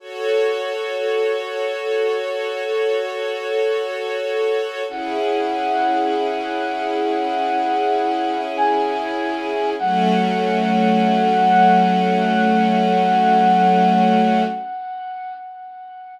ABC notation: X:1
M:4/4
L:1/8
Q:1/4=49
K:F#m
V:1 name="Brass Section"
z8 | f6 g2 | f8 |]
V:2 name="String Ensemble 1"
[FAc]8 | [CEG]8 | [F,A,C]8 |]